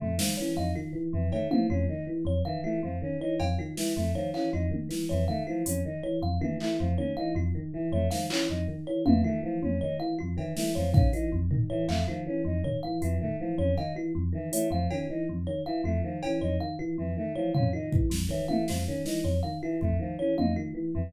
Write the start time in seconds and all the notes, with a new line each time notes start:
0.00 F2 A3, floor tom
0.18 D#3 F3, snare
0.37 E3 C#4 C#5
0.57 F2 D#4 F5
0.75 D#3 F4
0.93 E3
1.13 F2 E3
1.32 D#3 A3 C#5, cowbell
1.51 E3 F3 F5, high tom
1.70 F2 C#4 F4
1.89 D#3 D#4
2.07 E3
2.25 F2 C#5
2.45 D#3 E3 F5
2.64 E3 A3 F4
2.83 F2 F3
3.02 D#3 C#4
3.21 E3 D#4 C#5
3.40 F2 F5, cowbell
3.58 D#3 F4, cowbell
3.77 E3, snare
3.96 F2 A3
4.15 D#3 F3 C#5
4.34 E3 C#4 F5, clap
4.53 F2 D#4 F4
4.71 D#3, high tom
4.89 E3, snare
5.09 F2 E3 C#5
5.28 D#3 A3 F5
5.47 E3 F3 F4
5.66 F2 C#4, closed hi-hat
5.85 D#3 D#4
6.03 E3 C#5
6.22 F2 F5
6.41 D#3 E3 F4, high tom
6.60 E3 A3, clap
6.79 F2 F3
6.98 D#3 C#4 C#5, high tom
7.17 E3 D#4 F5
7.35 F2 F4
7.55 D#3
7.73 E3
7.92 F2 A3 C#5
8.11 D#3 F3 F5, snare
8.30 E3 C#4 F4, clap
8.49 F2 D#4
8.68 D#3
8.87 E3 C#5
9.06 F2 E3 F5, high tom
9.24 D#3 A3 F4
9.43 E3 F3
9.62 F2 C#4, high tom
9.81 D#3 D#4 C#5
9.99 E3 F5
10.19 F2 F4
10.37 D#3 E3, cowbell
10.57 E3 A3, snare
10.75 F2 F3 C#5
10.93 D#3 C#4 F5, kick
11.13 E3 D#4 F4, closed hi-hat
11.32 F2
11.51 D#3, floor tom
11.70 E3 C#5
11.88 F2 A3 F5, clap
12.08 D#3 F3 F4
12.26 E3 C#4
12.45 F2 D#4
12.64 D#3 C#5, floor tom
12.83 E3 F5
13.02 F2 E3 F4, closed hi-hat
13.21 D#3 A3, floor tom
13.39 E3 F3
13.58 F2 C#4 C#5
13.77 D#3 D#4 F5, cowbell
13.95 E3 F4
14.15 F2
14.33 D#3 E3
14.52 E3 A3 C#5, closed hi-hat
14.70 F2 F3 F5
14.90 D#3 C#4 F4, cowbell
15.09 E3 D#4
15.29 F2
15.47 D#3 C#5
15.66 E3 F5
15.84 F2 A3 F4
16.04 D#3 F3
16.23 E3 C#4, cowbell
16.41 F2 D#4 C#5
16.60 D#3 F5
16.79 E3 F4
16.98 F2 E3
17.17 D#3 A3
17.35 E3 F3 C#5
17.54 F2 C#4 F5, floor tom
17.73 D#3 D#4 F4
17.92 E3, kick
18.10 F2, snare
18.29 D#3 E3 C#5
18.48 E3 A3 F5, high tom
18.68 F2 F3 F4, snare
18.87 D#3 C#4
19.05 E3 D#4, snare
19.24 F2 C#5
19.43 D#3 F5
19.62 E3 F4
19.81 F2 A3, kick
19.99 D#3 F3
20.19 E3 C#4 C#5
20.38 F2 D#4 F5, high tom
20.56 D#3 F4
20.75 E3
20.94 F2 E3